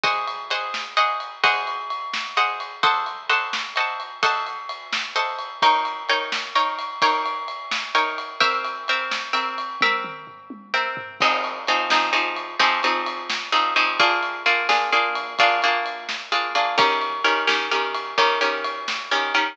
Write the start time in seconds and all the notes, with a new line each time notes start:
0.03 G#4 C5 D#5 F#5, kick, ride
0.28 ride
0.50 G#4 C5 D#5 F#5, ride
0.74 snare
0.97 G#4 C5 D#5 F#5, ride
1.20 ride
1.44 G#4 C5 D#5 F#5, kick, ride
1.67 ride
1.90 ride
2.13 snare
2.37 G#4 C5 D#5 F#5, ride
2.60 ride
2.83 A4 C5 D#5 F#5, kick, ride
3.06 ride
3.29 A4 C5 D#5 F#5, ride
3.53 snare
3.76 A4 C5 D#5 F#5, ride
4.00 ride
4.23 A4 C5 D#5 F#5, kick, ride
4.47 ride
4.69 ride
4.93 snare
5.16 A4 C5 D#5 F#5, ride
5.39 ride
5.62 D#4 A#4 C#5 G5, kick, ride
5.85 ride
6.09 D#4 A#4 C#5 G5, ride
6.32 snare
6.55 D#4 A#4 C#5 G5, ride
6.79 ride
7.02 D#4 A#4 C#5 G5, kick, ride
7.26 ride
7.48 ride
7.71 snare
7.95 D#4 A#4 C#5 G5, ride
8.18 ride
8.40 C4 A#4 E5 G5, kick, ride
8.65 ride
8.88 C4 A#4 E5 G5, ride
9.11 snare
9.33 C4 A#4 E5 G5, ride
9.58 ride
9.81 C4 A#4 E5 G5, kick, high tom
10.04 mid tom
10.27 floor tom
10.50 high tom
10.74 C4 A#4 E5 G5
10.97 floor tom
11.20 F3 C4 D#4 G#4, kick, crash
11.44 ride
11.67 F3 C4 D#4 G#4, ride
11.90 F3 C4 D#4 G#4, snare
12.13 F3 C4 D#4 G#4, ride
12.36 ride
12.59 F3 C4 D#4 G#4, kick, ride
12.83 F3 C4 D#4 G#4, ride
13.06 ride
13.30 snare
13.52 F3 C4 D#4 G#4, ride
13.76 F3 C4 D#4 G#4, ride
14.00 A#3 D4 F4 G#4, kick, ride
14.23 ride
14.46 A#3 D4 F4 G#4, ride
14.69 A#3 D4 F4 G#4, snare
14.92 A#3 D4 F4 G#4, ride
15.15 ride
15.39 A#3 D4 F4 G#4, kick, ride
15.62 A#3 D4 F4 G#4, ride
15.86 ride
16.09 snare
16.32 A#3 D4 F4 G#4, ride
16.55 A#3 D4 F4 G#4, ride
16.78 D#3 C#4 G4 A#4, kick, ride
17.01 ride
17.24 D#3 C#4 G4 A#4, ride
17.47 D#3 C#4 G4 A#4, snare
17.71 D#3 C#4 G4 A#4, ride
17.94 ride
18.18 D#3 C#4 G4 A#4, kick, ride
18.41 D#3 C#4 G4 A#4, ride
18.64 ride
18.88 snare
19.11 D#3 C#4 G4 A#4, ride
19.34 D#3 C#4 G4 A#4, ride